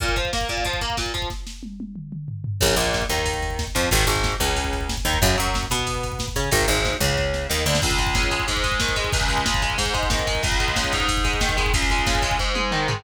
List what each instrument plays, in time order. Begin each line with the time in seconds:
0.00 overdriven guitar A#2, kick, closed hi-hat
0.08 kick
0.16 overdriven guitar F3, kick, closed hi-hat
0.25 kick
0.33 overdriven guitar A#3, kick, snare
0.41 kick
0.49 overdriven guitar A#2, kick, closed hi-hat
0.57 kick
0.65 overdriven guitar F3, kick, closed hi-hat
0.73 kick
0.81 overdriven guitar A#3, kick, closed hi-hat
0.90 kick
0.97 overdriven guitar A#2, kick, snare
1.06 kick
1.14 overdriven guitar F3, kick, closed hi-hat
1.22 kick
1.30 kick, snare
1.47 snare
1.63 high tom
1.80 high tom
1.96 mid tom
2.12 mid tom
2.28 floor tom
2.44 floor tom
2.61 electric bass (finger) A#1, overdriven guitar C#3, kick, crash
2.69 kick
2.76 electric bass (finger) A#1, overdriven guitar A#2, kick, ride
2.85 kick
2.94 kick, snare
3.02 kick
3.09 electric bass (finger) D#2, overdriven guitar D#3, kick, ride
3.19 kick
3.26 kick, ride
3.34 kick
3.43 kick, ride
3.50 kick
3.59 kick, snare
3.67 kick
3.75 electric bass (finger) F2, overdriven guitar F3, kick, ride
3.83 kick
3.91 electric bass (finger) G#1, overdriven guitar D#3, kick, ride
4.00 kick
4.07 electric bass (finger) G#1, overdriven guitar G#2, kick, ride
4.16 kick
4.24 kick, snare
4.32 kick
4.40 electric bass (finger) C#2, overdriven guitar C#3, kick, ride
4.48 kick
4.56 kick, ride
4.64 kick
4.73 kick, ride
4.81 kick
4.89 kick, snare
4.97 kick
5.05 electric bass (finger) D#2, overdriven guitar D#3, kick, ride
5.13 kick
5.22 electric bass (finger) F#2, overdriven guitar C#3, kick, ride
5.29 kick
5.38 electric bass (finger) F#2, overdriven guitar F#3, kick, ride
5.47 kick
5.54 kick, snare
5.63 kick
5.70 electric bass (finger) B2, overdriven guitar B3, kick, ride
5.79 kick
5.87 kick, ride
5.95 kick
6.03 kick, ride
6.12 kick
6.19 kick, snare
6.28 kick
6.36 electric bass (finger) C#3, overdriven guitar C#4, kick, ride
6.44 kick
6.51 electric bass (finger) G#1, overdriven guitar D#3, kick, ride
6.61 kick
6.68 electric bass (finger) G#1, overdriven guitar G#2, kick, ride
6.77 kick
6.85 kick, snare
6.93 kick
7.00 electric bass (finger) C#2, overdriven guitar C#3, kick, ride
7.09 kick
7.18 kick, snare
7.34 snare
7.50 electric bass (finger) D#2, overdriven guitar D#3, snare
7.58 snare
7.66 electric bass (finger) D2, overdriven guitar D3, snare
7.75 snare
7.82 overdriven guitar C#2, kick, crash
7.91 kick
7.98 overdriven guitar G#3, kick, ride
8.07 kick
8.15 overdriven guitar C#3, kick, snare
8.23 kick
8.31 overdriven guitar G#3, kick, ride
8.40 kick
8.48 overdriven guitar G#2, kick, ride
8.57 kick
8.63 overdriven guitar G#3, kick, ride
8.72 kick
8.80 overdriven guitar D#3, kick, snare
8.89 kick
8.96 overdriven guitar G#3, kick, ride
9.04 kick
9.13 overdriven guitar C#2, kick, ride
9.21 kick
9.29 overdriven guitar G#3, kick, ride
9.38 kick
9.46 overdriven guitar C#3, kick, snare
9.54 kick
9.62 overdriven guitar G#3, kick, ride
9.70 kick
9.78 overdriven guitar G#2, kick, ride
9.86 kick
9.94 overdriven guitar G#3, kick, ride
10.03 kick
10.10 overdriven guitar D#3, kick, snare
10.19 kick
10.27 overdriven guitar G#3, kick, ride
10.35 kick
10.43 overdriven guitar C#2, kick, ride
10.52 kick
10.60 overdriven guitar G#3, kick, ride
10.68 kick
10.76 overdriven guitar C#3, kick, snare
10.84 kick
10.92 overdriven guitar G#2, kick, ride
11.00 kick
11.09 kick, ride
11.17 kick
11.24 overdriven guitar G#3, kick, ride
11.33 kick
11.41 overdriven guitar D#3, kick, snare
11.49 kick
11.57 overdriven guitar G#3, kick, ride
11.66 kick
11.74 overdriven guitar C#2, kick, ride
11.82 kick
11.90 overdriven guitar G#3, kick, ride
11.99 kick
12.07 overdriven guitar C#3, kick, snare
12.15 kick
12.22 overdriven guitar G#3, kick, ride
12.31 kick
12.39 overdriven guitar G#2, kick
12.55 overdriven guitar G#3, high tom
12.71 overdriven guitar D#3, mid tom
12.88 overdriven guitar G#3, floor tom